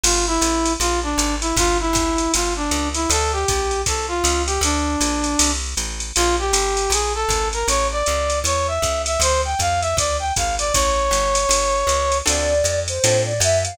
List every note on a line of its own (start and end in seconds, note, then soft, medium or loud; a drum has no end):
0.04 0.39 G1 medium
0.04 0.25 F4 medium
0.04 crash loud
0.04 ride loud
0.27 0.73 E4 loud
0.41 0.77 A1 medium
0.41 hi-hat pedal loud
0.41 ride medium
0.65 ride medium
0.80 1.15 A#1 medium
0.80 1.00 F4 loud
0.80 ride loud
1.03 1.35 D4 medium
1.18 1.53 G#1 medium
1.18 hi-hat pedal loud
1.18 ride medium
1.41 1.56 E4 medium
1.41 ride medium
1.56 1.91 G1 medium
1.56 1.77 F4 loud
1.56 kick medium
1.56 ride loud
1.80 2.32 E4 medium
1.93 2.28 G1 medium
1.93 kick medium
1.93 hi-hat pedal loud
1.93 ride medium
2.18 ride medium
2.34 2.70 G1 medium
2.34 2.54 F4 medium
2.34 ride loud
2.56 2.89 D4 medium
2.71 3.06 C#2 medium
2.71 hi-hat pedal loud
2.71 ride medium
2.94 3.09 E4 medium
2.94 ride medium
3.10 3.45 D2 medium
3.10 3.32 A4 loud
3.10 ride loud
3.33 3.82 G4 medium
3.48 3.84 A#1 medium
3.48 kick medium
3.48 hi-hat pedal medium
3.48 ride medium
3.71 ride medium
3.86 4.22 C2 medium
3.86 4.06 A4 medium
3.86 kick medium
3.86 ride loud
4.08 4.42 F4 medium
4.24 4.59 C#2 medium
4.24 hi-hat pedal loud
4.24 ride loud
4.46 4.61 G4 medium
4.46 ride medium
4.61 4.96 D2 medium
4.61 5.51 D4 medium
4.61 ride loud
5.00 5.36 A#1 medium
5.00 hi-hat pedal medium
5.00 ride loud
5.24 ride medium
5.39 5.75 C2 medium
5.39 ride loud
5.77 6.12 A1 medium
5.77 hi-hat pedal medium
5.77 ride medium
6.00 ride medium
6.16 6.52 A#1 medium
6.16 6.36 F4 loud
6.16 ride loud
6.39 6.91 G4 medium
6.53 6.88 G1 medium
6.53 hi-hat pedal loud
6.53 ride loud
6.77 ride medium
6.90 7.25 A#1 medium
6.90 7.13 G#4 medium
6.90 ride loud
7.15 7.48 A4 loud
7.29 7.64 G#1 medium
7.29 kick medium
7.29 hi-hat pedal medium
7.29 ride medium
7.53 7.67 A#4 medium
7.53 ride medium
7.68 8.03 A1 medium
7.68 7.87 C#5 loud
7.68 ride loud
7.92 8.39 D5 loud
8.06 8.43 C#2 medium
8.06 hi-hat pedal medium
8.06 ride medium
8.30 ride medium
8.44 8.79 E2 medium
8.44 8.67 C#5 loud
8.44 ride loud
8.68 9.02 E5 medium
8.82 9.17 C#2 medium
8.82 kick medium
8.82 hi-hat pedal medium
8.82 ride medium
9.06 9.20 E5 medium
9.06 ride medium
9.20 9.55 D2 medium
9.20 9.41 C5 loud
9.20 ride loud
9.45 9.60 G5 medium
9.59 9.94 F2 medium
9.59 9.81 F5 loud
9.59 kick medium
9.59 hi-hat pedal medium
9.59 ride medium
9.81 9.96 E5 medium
9.81 ride medium
9.97 10.32 D2 medium
9.97 10.17 D5 loud
9.97 kick medium
9.97 ride loud
10.20 10.33 G5 medium
10.36 10.72 G#1 medium
10.36 10.55 F5 medium
10.36 kick medium
10.36 hi-hat pedal medium
10.36 ride medium
10.59 10.73 D5 loud
10.59 ride medium
10.73 11.10 A1 medium
10.73 12.18 C#5 loud
10.73 kick medium
10.73 ride loud
11.11 11.46 G1 medium
11.11 hi-hat pedal medium
11.11 ride medium
11.35 ride loud
11.49 11.84 G1 medium
11.49 ride loud
11.87 12.22 C#2 medium
11.87 hi-hat pedal medium
11.87 ride medium
12.12 ride medium
12.25 12.62 D2 medium
12.25 12.54 C4 loud
12.25 12.54 D4 loud
12.25 12.54 F4 loud
12.25 12.54 A4 loud
12.25 12.80 D5 medium
12.25 ride loud
12.64 12.99 F2 medium
12.64 hi-hat pedal medium
12.64 ride medium
12.88 13.23 C5 medium
12.88 ride medium
13.04 13.39 A2 medium
13.04 13.33 C4 medium
13.04 13.33 D4 medium
13.04 13.33 F4 loud
13.04 13.33 A4 medium
13.04 ride loud
13.26 13.40 D5 medium
13.40 13.75 F#2 medium
13.40 13.63 E5 medium
13.40 hi-hat pedal medium
13.40 ride loud
13.65 13.77 F5 medium
13.65 ride medium